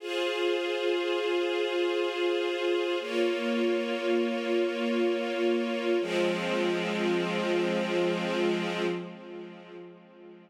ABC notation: X:1
M:3/4
L:1/8
Q:1/4=60
K:Fm
V:1 name="String Ensemble 1"
[FAc]6 | [B,Fd]6 | [F,A,C]6 |]